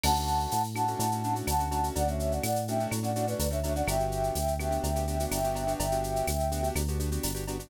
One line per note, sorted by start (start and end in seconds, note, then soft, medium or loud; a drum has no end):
0.04 0.47 D2 medium
0.04 0.13 A3 medium
0.04 0.13 C#4 medium
0.04 0.13 D4 medium
0.04 0.13 F#4 medium
0.04 0.62 F#5 loud
0.04 0.62 A5 loud
0.04 crash loud
0.04 cowbell medium
0.04 claves loud
0.16 0.55 A3 medium
0.16 0.55 C#4 medium
0.16 0.55 D4 medium
0.16 0.55 F#4 medium
0.16 shaker medium
0.27 shaker medium
0.40 shaker medium
0.52 0.95 A2 medium
0.52 tambourine medium
0.52 shaker loud
0.64 shaker medium
0.74 0.85 A3 medium
0.74 0.85 C#4 medium
0.74 0.85 D4 medium
0.74 0.85 F#4 medium
0.74 1.34 F#5 medium
0.74 1.34 A5 medium
0.74 claves medium
0.74 shaker medium
0.88 1.07 A3 medium
0.88 1.07 C#4 medium
0.88 1.07 D4 medium
0.88 1.07 F#4 medium
0.88 shaker medium
0.99 1.42 A2 medium
0.99 cowbell medium
0.99 shaker loud
1.11 1.22 A3 medium
1.11 1.22 C#4 medium
1.11 1.22 D4 medium
1.11 1.22 F#4 medium
1.11 shaker medium
1.24 1.34 A3 medium
1.24 1.34 C#4 medium
1.24 1.34 D4 medium
1.24 1.34 F#4 medium
1.24 shaker medium
1.35 1.54 A3 medium
1.35 1.54 C#4 medium
1.35 1.54 D4 medium
1.35 1.54 F#4 medium
1.35 shaker medium
1.47 1.90 D2 medium
1.47 1.88 F#5 medium
1.47 1.88 A5 medium
1.47 tambourine medium
1.47 cowbell medium
1.47 claves medium
1.47 shaker loud
1.59 1.69 A3 medium
1.59 1.69 C#4 medium
1.59 1.69 D4 medium
1.59 1.69 F#4 medium
1.59 shaker medium
1.71 1.81 A3 medium
1.71 1.81 C#4 medium
1.71 1.81 D4 medium
1.71 1.81 F#4 medium
1.71 cowbell medium
1.71 shaker medium
1.83 2.02 A3 medium
1.83 2.02 C#4 medium
1.83 2.02 D4 medium
1.83 2.02 F#4 medium
1.83 shaker medium
1.96 2.39 D2 medium
1.96 2.07 D5 medium
1.96 2.07 F#5 loud
1.96 cowbell medium
1.96 shaker loud
2.08 2.46 A3 medium
2.08 2.46 C#4 medium
2.08 2.46 D4 medium
2.08 2.46 F#4 medium
2.08 2.33 C#5 medium
2.08 2.33 E5 medium
2.08 shaker medium
2.19 shaker medium
2.32 2.43 D5 medium
2.32 2.43 F#5 medium
2.32 shaker medium
2.43 2.87 A2 medium
2.43 2.65 D5 medium
2.43 2.65 F#5 medium
2.43 tambourine medium
2.43 claves loud
2.43 shaker loud
2.56 shaker medium
2.67 2.78 A3 medium
2.67 2.78 C#4 medium
2.67 2.78 D4 medium
2.67 2.78 F#4 medium
2.67 2.87 E5 medium
2.67 2.87 G5 medium
2.67 shaker medium
2.79 2.99 A3 medium
2.79 2.99 C#4 medium
2.79 2.99 D4 medium
2.79 2.99 F#4 medium
2.79 shaker medium
2.91 3.35 A2 medium
2.91 cowbell medium
2.91 claves medium
2.91 shaker loud
3.03 3.12 A3 medium
3.03 3.12 C#4 medium
3.03 3.12 D4 medium
3.03 3.12 F#4 medium
3.03 3.26 D5 medium
3.03 3.26 F#5 medium
3.03 shaker medium
3.16 3.25 A3 medium
3.16 3.25 C#4 medium
3.16 3.25 D4 medium
3.16 3.25 F#4 medium
3.16 shaker medium
3.27 3.46 A3 medium
3.27 3.46 C#4 medium
3.27 3.46 D4 medium
3.27 3.46 F#4 medium
3.27 3.48 B4 medium
3.27 3.48 D5 medium
3.27 shaker medium
3.39 3.83 D2 medium
3.39 tambourine medium
3.39 cowbell medium
3.39 shaker loud
3.51 3.60 A3 medium
3.51 3.60 C#4 medium
3.51 3.60 D4 medium
3.51 3.60 F#4 medium
3.51 3.73 C#5 medium
3.51 3.73 E5 medium
3.51 shaker medium
3.63 3.74 A3 medium
3.63 3.74 C#4 medium
3.63 3.74 D4 medium
3.63 3.74 F#4 medium
3.63 cowbell medium
3.63 shaker medium
3.75 3.85 A3 medium
3.75 3.85 C#4 medium
3.75 3.85 D4 medium
3.75 3.85 F#4 medium
3.75 3.87 D5 medium
3.75 3.87 F#5 medium
3.75 shaker medium
3.87 4.31 G1 loud
3.87 3.96 B3 medium
3.87 3.96 D4 medium
3.87 3.96 F#4 medium
3.87 3.96 G4 loud
3.87 4.54 E5 medium
3.87 4.54 G5 loud
3.87 cowbell loud
3.87 claves loud
3.87 shaker loud
4.00 4.39 B3 medium
4.00 4.39 D4 medium
4.00 4.39 F#4 medium
4.00 4.39 G4 medium
4.00 shaker medium
4.12 shaker medium
4.23 shaker medium
4.35 4.79 D2 medium
4.35 tambourine medium
4.35 shaker loud
4.48 shaker medium
4.59 4.69 B3 medium
4.59 4.69 D4 medium
4.59 4.69 F#4 medium
4.59 4.69 G4 medium
4.59 5.25 E5 medium
4.59 5.25 G5 medium
4.59 claves medium
4.59 shaker medium
4.71 4.90 B3 medium
4.71 4.90 D4 medium
4.71 4.90 F#4 medium
4.71 4.90 G4 medium
4.71 shaker medium
4.83 5.26 D2 medium
4.83 cowbell medium
4.83 shaker loud
4.96 5.05 B3 medium
4.96 5.05 D4 medium
4.96 5.05 F#4 medium
4.96 5.05 G4 medium
4.96 shaker medium
5.07 5.17 B3 medium
5.07 5.17 D4 medium
5.07 5.17 F#4 medium
5.07 5.17 G4 medium
5.07 shaker medium
5.20 5.39 B3 medium
5.20 5.39 D4 medium
5.20 5.39 F#4 medium
5.20 5.39 G4 medium
5.20 shaker medium
5.30 5.75 G1 medium
5.30 5.73 E5 medium
5.30 5.73 G5 medium
5.30 tambourine medium
5.30 cowbell medium
5.30 claves medium
5.30 shaker loud
5.44 5.54 B3 medium
5.44 5.54 D4 medium
5.44 5.54 F#4 medium
5.44 5.54 G4 medium
5.44 shaker medium
5.55 5.64 B3 medium
5.55 5.64 D4 medium
5.55 5.64 F#4 medium
5.55 5.64 G4 medium
5.55 cowbell medium
5.55 shaker medium
5.67 5.86 B3 medium
5.67 5.86 D4 medium
5.67 5.86 F#4 medium
5.67 5.86 G4 medium
5.67 shaker medium
5.78 6.23 G1 medium
5.78 6.68 E5 medium
5.78 6.68 G5 medium
5.78 cowbell loud
5.78 shaker loud
5.92 6.30 B3 medium
5.92 6.30 D4 medium
5.92 6.30 F#4 medium
5.92 6.30 G4 medium
5.92 shaker medium
6.04 shaker medium
6.16 shaker medium
6.27 6.70 D2 medium
6.27 tambourine medium
6.27 claves loud
6.27 shaker loud
6.40 shaker medium
6.52 6.61 B3 medium
6.52 6.61 D4 medium
6.52 6.61 F#4 medium
6.52 6.61 G4 medium
6.52 shaker medium
6.63 6.82 B3 medium
6.63 6.82 D4 medium
6.63 6.82 F#4 medium
6.63 6.82 G4 medium
6.63 shaker medium
6.75 7.18 D2 medium
6.75 cowbell medium
6.75 claves loud
6.75 shaker loud
6.88 6.98 B3 medium
6.88 6.98 D4 medium
6.88 6.98 F#4 medium
6.88 6.98 G4 medium
6.88 shaker medium
7.00 7.09 B3 medium
7.00 7.09 D4 medium
7.00 7.09 F#4 medium
7.00 7.09 G4 medium
7.00 shaker medium
7.12 7.31 B3 medium
7.12 7.31 D4 medium
7.12 7.31 F#4 medium
7.12 7.31 G4 medium
7.12 shaker medium
7.23 7.67 G1 medium
7.23 tambourine medium
7.23 cowbell medium
7.23 shaker loud
7.34 7.44 B3 medium
7.34 7.44 D4 medium
7.34 7.44 F#4 medium
7.34 7.44 G4 medium
7.34 shaker medium
7.47 7.58 B3 medium
7.47 7.58 D4 medium
7.47 7.58 F#4 medium
7.47 7.58 G4 medium
7.47 cowbell medium
7.47 shaker medium
7.59 7.69 B3 medium
7.59 7.69 D4 medium
7.59 7.69 F#4 medium
7.59 7.69 G4 medium
7.59 shaker medium